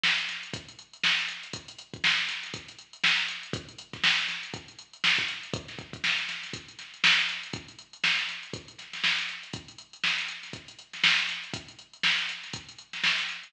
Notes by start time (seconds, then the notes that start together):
0.04 snare
0.18 closed hi-hat
0.29 snare, closed hi-hat
0.43 closed hi-hat
0.54 kick, closed hi-hat
0.69 closed hi-hat
0.79 closed hi-hat
0.93 closed hi-hat
1.04 snare
1.18 closed hi-hat
1.29 closed hi-hat
1.43 closed hi-hat
1.53 kick, closed hi-hat
1.68 closed hi-hat
1.79 closed hi-hat
1.94 kick, closed hi-hat
2.04 snare
2.18 snare, closed hi-hat
2.29 snare, closed hi-hat
2.43 snare, closed hi-hat
2.54 kick, closed hi-hat
2.68 closed hi-hat
2.79 closed hi-hat
2.93 closed hi-hat
3.04 snare
3.18 closed hi-hat
3.28 closed hi-hat
3.43 closed hi-hat
3.53 kick, closed hi-hat
3.69 closed hi-hat
3.79 closed hi-hat
3.93 kick, snare, closed hi-hat
4.04 snare
4.18 closed hi-hat
4.28 snare, closed hi-hat
4.43 closed hi-hat
4.54 kick, closed hi-hat
4.68 closed hi-hat
4.79 closed hi-hat
4.93 closed hi-hat
5.04 snare
5.18 kick, closed hi-hat
5.28 closed hi-hat
5.43 closed hi-hat
5.54 kick, closed hi-hat
5.68 snare, closed hi-hat
5.79 kick, closed hi-hat
5.93 kick, closed hi-hat
6.04 snare
6.18 closed hi-hat
6.29 snare, closed hi-hat
6.43 snare, closed hi-hat
6.53 kick, closed hi-hat
6.69 closed hi-hat
6.79 snare, closed hi-hat
6.94 closed hi-hat
7.04 snare
7.19 closed hi-hat
7.29 closed hi-hat
7.43 closed hi-hat
7.53 kick, closed hi-hat
7.68 closed hi-hat
7.79 closed hi-hat
7.93 closed hi-hat
8.04 snare
8.18 snare, closed hi-hat
8.29 snare, closed hi-hat
8.43 closed hi-hat
8.54 kick, closed hi-hat
8.68 closed hi-hat
8.79 snare, closed hi-hat
8.93 snare, closed hi-hat
9.04 snare
9.19 closed hi-hat
9.29 closed hi-hat
9.43 closed hi-hat
9.53 kick, closed hi-hat
9.68 closed hi-hat
9.78 closed hi-hat
9.93 closed hi-hat
10.04 snare
10.18 closed hi-hat
10.28 closed hi-hat
10.43 snare, closed hi-hat
10.53 kick, closed hi-hat
10.68 closed hi-hat
10.79 closed hi-hat
10.93 snare, closed hi-hat
11.04 snare
11.19 closed hi-hat
11.29 snare, closed hi-hat
11.44 closed hi-hat
11.54 kick, closed hi-hat
11.68 closed hi-hat
11.79 closed hi-hat
11.93 closed hi-hat
12.03 snare
12.18 closed hi-hat
12.29 closed hi-hat
12.44 snare, closed hi-hat
12.53 kick, closed hi-hat
12.69 closed hi-hat
12.79 closed hi-hat
12.93 snare, closed hi-hat
13.04 snare
13.19 closed hi-hat
13.29 closed hi-hat
13.43 snare, closed hi-hat